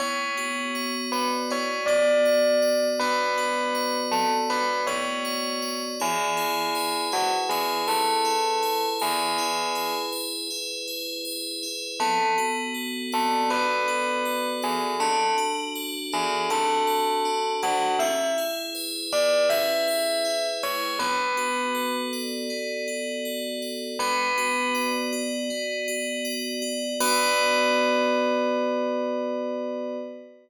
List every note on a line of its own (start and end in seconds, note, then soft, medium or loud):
0.00 1.50 B3 medium
0.00 0.94 C#5 medium
0.37 1.87 F#4 medium
0.75 2.25 C#5 medium
1.12 1.30 B4 medium
1.12 2.62 D5 medium
1.50 3.00 B3 medium
1.50 1.85 C#5 medium
1.86 3.37 F#4 medium
1.86 2.86 D5 medium
2.25 3.74 C#5 medium
2.62 4.12 D5 medium
3.00 4.49 B3 medium
3.00 3.97 B4 medium
3.38 4.87 F#4 medium
3.75 5.24 C#5 medium
4.11 4.29 A4 medium
4.11 5.62 D5 medium
4.50 5.92 B3 medium
4.50 4.81 B4 medium
4.87 5.94 F#4 medium
4.87 5.81 C#5 medium
5.25 5.96 C#5 medium
5.62 5.98 D5 medium
6.00 7.12 E4 medium
6.00 7.05 G#4 medium
6.37 7.50 G#4 medium
6.75 7.87 B4 medium
7.12 8.24 E4 medium
7.12 7.31 F#4 medium
7.49 7.84 G#4 medium
7.49 8.62 G#4 medium
7.88 8.86 A4 medium
7.88 8.99 B4 medium
8.25 9.38 E4 medium
8.63 9.75 G#4 medium
8.99 9.94 G#4 medium
8.99 10.12 B4 medium
9.38 10.50 E4 medium
9.75 10.87 G#4 medium
10.12 11.24 B4 medium
10.50 11.62 E4 medium
10.88 11.94 G#4 medium
11.25 11.96 B4 medium
11.63 11.99 E4 medium
12.00 13.50 B3 medium
12.00 12.33 A4 medium
12.38 13.87 F#4 medium
12.74 14.25 A4 medium
13.12 13.49 A4 medium
13.12 14.62 D5 medium
13.50 14.93 B3 medium
13.50 14.47 B4 medium
13.88 14.95 F#4 medium
14.25 14.97 A4 medium
14.62 14.94 G#4 medium
14.62 14.98 D5 medium
15.00 16.12 D4 medium
15.00 15.34 A4 medium
15.38 16.50 F#4 medium
15.75 16.87 A4 medium
16.12 17.25 D4 medium
16.12 16.46 G#4 medium
16.50 17.62 F#4 medium
16.50 17.53 A4 medium
16.87 17.94 A4 medium
17.25 17.96 D4 medium
17.62 17.98 F#4 medium
17.62 17.94 F#4 medium
17.99 19.12 E4 medium
17.99 18.34 E5 medium
18.38 19.50 G#4 medium
18.75 19.87 B4 medium
19.12 20.24 E4 medium
19.12 19.45 D5 medium
19.50 20.62 G#4 medium
19.50 20.46 E5 medium
19.88 20.94 B4 medium
20.25 20.96 E4 medium
20.63 20.99 G#4 medium
20.63 20.99 C#5 medium
20.99 22.50 B3 medium
20.99 21.94 B4 medium
21.37 22.87 F#4 medium
21.75 23.25 A4 medium
22.13 23.62 D5 medium
22.50 23.93 B3 medium
22.88 23.95 F#4 medium
23.25 23.96 A4 medium
23.62 23.98 D5 medium
23.99 25.50 B3 medium
23.99 24.90 B4 medium
24.38 25.12 F#4 medium
24.75 26.24 D5 medium
25.13 25.87 F#4 medium
25.50 26.93 B3 medium
25.88 26.61 F#4 medium
26.25 26.96 D5 medium
26.62 26.98 F#4 medium
27.00 29.96 B3 loud
27.00 29.96 F#4 loud
27.00 29.96 B4 loud
27.00 29.96 D5 loud